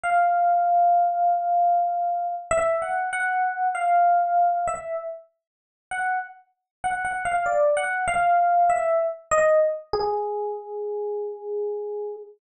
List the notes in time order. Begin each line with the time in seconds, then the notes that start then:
0.04 F5
2.51 E5
2.82 F#5
3.13 F#5
3.75 F5
4.68 E5
5.91 F#5
6.84 F#5
7.05 F#5
7.25 F5
7.46 D5
7.77 F#5
8.08 F5
8.70 E5
9.31 D#5
9.93 G#4